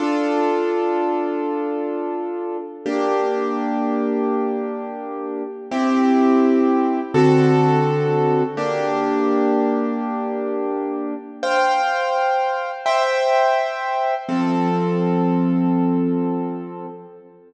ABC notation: X:1
M:4/4
L:1/8
Q:1/4=84
K:F
V:1 name="Acoustic Grand Piano"
[DFA]8 | [B,DG]8 | [CEG]4 [D,C^FA]4 | [B,DG]8 |
[cfg]4 [ceg]4 | [F,CA]8 |]